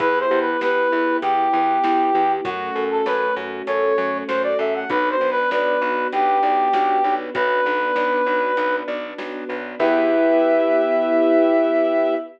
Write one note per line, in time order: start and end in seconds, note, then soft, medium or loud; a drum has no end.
0.00 0.26 E2 loud
0.00 2.41 B3 medium
0.00 0.27 E4 medium
0.00 2.41 E4 medium
0.00 2.41 G4 medium
0.00 0.19 B4 medium
0.00 kick loud
0.00 closed hi-hat loud
0.20 0.39 C5 medium
0.31 0.57 E2 medium
0.31 0.58 G4 medium
0.41 0.60 B4 medium
0.61 0.88 E2 medium
0.61 0.89 B4 medium
0.61 1.17 B4 medium
0.61 snare loud
0.92 1.18 E2 medium
0.92 1.19 E4 medium
1.22 1.48 E2 medium
1.22 2.32 G4 medium
1.22 1.50 G4 medium
1.22 closed hi-hat loud
1.53 1.79 E2 medium
1.53 1.80 B4 medium
1.84 2.10 E2 medium
1.84 2.11 E4 medium
1.84 snare loud
2.14 2.41 E2 medium
2.14 2.42 G4 medium
2.44 2.71 F#2 loud
2.44 4.86 A3 medium
2.44 4.86 C#4 medium
2.44 4.86 F#4 medium
2.44 2.72 F#4 medium
2.44 2.84 F#4 medium
2.44 kick loud
2.44 closed hi-hat loud
2.76 3.02 F#2 medium
2.76 3.03 A4 medium
2.91 3.06 A4 medium
3.06 3.32 F#2 medium
3.06 3.35 B4 medium
3.06 3.34 C#5 medium
3.06 snare loud
3.36 3.62 F#2 medium
3.36 3.65 F#4 medium
3.67 3.93 F#2 medium
3.67 3.95 A4 medium
3.67 4.18 C#5 medium
3.67 closed hi-hat loud
3.98 4.24 F#2 medium
3.98 4.25 C#5 medium
4.28 4.55 F#2 medium
4.28 4.56 F#4 medium
4.28 4.42 C5 medium
4.28 snare loud
4.43 4.58 D5 medium
4.59 4.85 F#2 medium
4.59 4.87 A4 medium
4.59 4.74 E5 medium
4.75 4.90 F#5 medium
4.90 5.16 B1 loud
4.90 7.33 B3 medium
4.90 7.33 D4 medium
4.90 5.17 F#4 medium
4.90 7.33 F#4 medium
4.90 5.09 B4 medium
4.90 kick loud
4.90 closed hi-hat loud
5.10 5.30 C5 medium
5.21 5.47 B1 medium
5.21 5.48 B4 medium
5.31 5.50 B4 medium
5.51 5.77 B1 medium
5.51 6.08 B4 medium
5.51 5.79 D5 medium
5.51 snare loud
5.82 6.08 B1 medium
5.82 6.09 F#4 medium
6.13 6.39 B1 medium
6.13 7.15 G4 medium
6.13 6.40 B4 medium
6.13 closed hi-hat loud
6.43 6.69 B1 medium
6.43 6.71 D5 medium
6.73 7.00 B1 medium
6.73 7.01 F#4 medium
6.73 snare loud
7.04 7.30 B1 medium
7.04 7.32 B4 medium
7.34 7.61 B1 loud
7.34 9.78 B3 medium
7.34 9.78 D4 medium
7.34 7.62 F#4 medium
7.34 9.78 F#4 medium
7.34 8.76 B4 medium
7.34 kick loud
7.34 closed hi-hat loud
7.66 7.92 B1 medium
7.66 7.93 B4 medium
7.96 8.22 B1 medium
7.96 8.23 D5 medium
7.96 snare loud
8.26 8.52 B1 medium
8.26 8.54 F#4 medium
8.57 8.83 B1 medium
8.57 8.85 B4 medium
8.57 closed hi-hat loud
8.88 9.14 B1 medium
8.88 9.15 D5 medium
9.18 9.44 B1 medium
9.18 9.46 F#4 medium
9.18 snare loud
9.49 9.75 B1 medium
9.49 9.76 B4 medium
9.79 12.15 E2 loud
9.79 12.14 B3 medium
9.79 12.14 E4 loud
9.79 12.15 E4 loud
9.79 12.14 G4 loud
9.79 12.15 G4 loud
9.79 12.15 B4 loud
9.79 12.15 E5 loud
9.79 kick loud
9.79 crash loud